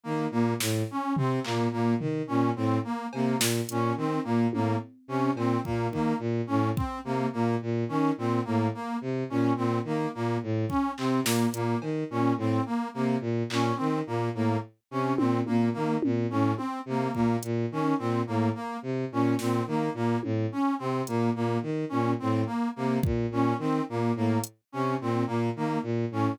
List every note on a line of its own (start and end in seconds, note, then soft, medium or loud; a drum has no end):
0.04 0.27 D#3 medium
0.04 0.26 A#3 medium
0.31 0.54 A#2 medium
0.31 0.54 A#3 medium
0.60 0.83 A2 medium
0.60 snare medium
0.91 1.13 C#4 medium
1.16 1.39 C3 medium
1.16 1.40 C4 medium
1.16 floor tom loud
1.44 1.68 A#2 medium
1.44 1.66 A#3 medium
1.44 clap medium
1.72 1.95 A#2 medium
1.72 1.94 A#3 medium
2.00 2.22 D#3 medium
2.00 floor tom medium
2.27 2.51 A#2 medium
2.27 2.50 C#4 medium
2.56 2.79 A2 medium
2.56 2.78 C4 medium
2.84 3.07 A#3 medium
3.13 3.36 C3 medium
3.13 3.37 A#3 medium
3.13 cowbell medium
3.39 3.61 A#2 medium
3.39 snare loud
3.69 3.92 A#2 medium
3.69 3.93 C#4 medium
3.69 closed hi-hat loud
3.97 4.19 D#3 medium
3.97 4.20 C4 medium
4.24 4.47 A#2 medium
4.24 4.46 A#3 medium
4.53 4.76 A2 medium
4.53 4.76 A#3 medium
4.53 high tom medium
5.08 5.30 C3 medium
5.08 5.31 C#4 medium
5.35 5.57 A#2 medium
5.35 5.60 C4 medium
5.35 cowbell medium
5.65 5.88 A#2 medium
5.65 5.87 A#3 medium
5.65 kick medium
5.91 6.13 D#3 medium
5.91 6.16 A#3 medium
5.91 kick medium
6.19 6.41 A#2 medium
6.47 6.71 A2 medium
6.47 6.69 C#4 medium
6.76 6.99 C4 medium
6.76 kick loud
7.05 7.27 C3 medium
7.05 7.27 A#3 medium
7.33 7.56 A#2 medium
7.33 7.55 A#3 medium
7.62 7.84 A#2 medium
7.89 8.11 D#3 medium
7.89 8.11 C#4 medium
8.18 8.40 A#2 medium
8.18 8.41 C4 medium
8.45 8.69 A2 medium
8.45 8.67 A#3 medium
8.74 8.97 A#3 medium
9.01 9.24 C3 medium
9.30 9.53 A#2 medium
9.30 9.52 C#4 medium
9.56 9.79 A#2 medium
9.56 9.79 C4 medium
9.84 10.07 D#3 medium
9.84 10.09 A#3 medium
10.14 10.38 A#2 medium
10.14 10.37 A#3 medium
10.43 10.65 A2 medium
10.69 10.91 C#4 medium
10.69 kick medium
10.98 11.20 C3 medium
10.98 11.20 C4 medium
10.98 clap medium
11.24 11.46 A#2 medium
11.24 11.48 A#3 medium
11.24 snare loud
11.53 11.75 A#2 medium
11.53 11.77 A#3 medium
11.53 closed hi-hat medium
11.81 12.04 D#3 medium
11.81 cowbell medium
12.10 12.33 A#2 medium
12.10 12.33 C#4 medium
12.37 12.59 A2 medium
12.37 12.62 C4 medium
12.66 12.88 A#3 medium
12.94 13.17 C3 medium
12.94 13.16 A#3 medium
13.21 13.43 A#2 medium
13.50 13.72 A#2 medium
13.50 13.74 C#4 medium
13.50 clap medium
13.76 14.02 D#3 medium
13.76 13.99 C4 medium
14.07 14.29 A#2 medium
14.07 14.29 A#3 medium
14.34 14.57 A2 medium
14.34 14.57 A#3 medium
14.91 15.13 C3 medium
14.91 15.14 C#4 medium
15.17 15.41 A#2 medium
15.17 15.39 C4 medium
15.17 high tom loud
15.46 15.70 A#2 medium
15.46 15.69 A#3 medium
15.46 high tom medium
15.73 15.98 D#3 medium
15.73 15.95 A#3 medium
16.02 16.27 A#2 medium
16.02 high tom loud
16.30 16.53 A2 medium
16.30 16.53 C#4 medium
16.57 16.79 C4 medium
16.57 high tom medium
16.86 17.08 C3 medium
16.86 17.11 A#3 medium
17.14 17.37 A#2 medium
17.14 17.37 A#3 medium
17.14 kick medium
17.43 17.66 A#2 medium
17.43 closed hi-hat medium
17.71 17.94 D#3 medium
17.71 17.95 C#4 medium
17.98 18.22 A#2 medium
17.98 18.21 C4 medium
18.27 18.50 A2 medium
18.27 18.49 A#3 medium
18.55 18.77 A#3 medium
18.82 19.05 C3 medium
19.12 19.34 A#2 medium
19.12 19.35 C#4 medium
19.39 19.61 A#2 medium
19.39 19.63 C4 medium
19.39 snare medium
19.67 19.89 D#3 medium
19.67 19.91 A#3 medium
19.94 20.16 A#2 medium
19.94 20.18 A#3 medium
20.23 20.46 A2 medium
20.23 high tom medium
20.52 20.74 C#4 medium
20.79 21.02 C3 medium
20.79 21.01 C4 medium
21.07 21.30 A#2 medium
21.07 21.30 A#3 medium
21.07 closed hi-hat medium
21.35 21.58 A#2 medium
21.35 21.58 A#3 medium
21.62 21.85 D#3 medium
21.89 22.14 A#2 medium
21.89 22.12 C#4 medium
22.19 22.44 A2 medium
22.19 22.42 C4 medium
22.46 22.68 A#3 medium
22.76 22.99 C3 medium
22.76 22.98 A#3 medium
23.03 23.26 A#2 medium
23.03 kick loud
23.31 23.53 A#2 medium
23.31 23.55 C#4 medium
23.59 23.81 D#3 medium
23.59 23.82 C4 medium
23.89 24.12 A#2 medium
23.89 24.12 A#3 medium
24.16 24.38 A2 medium
24.16 24.39 A#3 medium
24.44 closed hi-hat loud
24.72 24.96 C3 medium
24.72 24.95 C#4 medium
25.01 25.23 A#2 medium
25.01 25.24 C4 medium
25.27 25.50 A#2 medium
25.27 25.49 A#3 medium
25.56 25.78 D#3 medium
25.56 25.79 A#3 medium
25.83 26.05 A#2 medium
26.11 26.34 A2 medium
26.11 26.35 C#4 medium